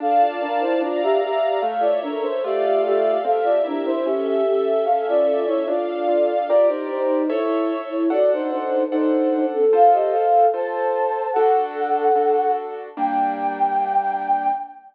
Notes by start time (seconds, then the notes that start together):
0.00 D4 A4 D5 F5 A5
0.21 F4 D5
0.40 D4 F4 A#4
0.60 E4 C5
0.81 D4 F4 D5 F5 A#5
1.02 G4 E5
1.21 G4 A#4 E5
1.60 A3 A4 C#5 E5 F5
1.80 F4 D5
2.02 D4 A#4 C#5
2.22 C5
2.43 A3 F4 G4 A4 D5 E5 F5
2.63 G4 E5
2.85 G4 E5
3.24 C4 G4 A4 E5 F5
3.43 F4 D5
3.64 D4 E4 A#4
3.85 E4 C5
4.05 C#4 G4 A4 E5
4.26 G4 E5
4.45 G4 A4 E5
4.85 C#4 A4 E5 F5
5.08 F4 D5
5.27 F4 A4 D5
5.46 E4 C#5
5.66 D4 F4 A4 D5 F5
6.08 F4
6.47 F4 G4 A#4 D5
6.68 D#4 C5
6.91 D#4 C5
7.30 E4 A4 C#5 E5
7.89 E4 C#5
8.10 D4 F#4 A4 D5 F#5
8.33 D#4 C5
8.50 D#4 C5
8.90 D4 D#4 A4 C5 F#5
9.53 C4 A4
9.73 F4 A4 C5 F5
9.93 G4 D#5
10.12 A4 F5
10.54 F4 A4 C5 A5
11.33 D4 F#4 A4 F#5
12.15 D4 F#4 A4
12.97 G3 A#3 D4 G5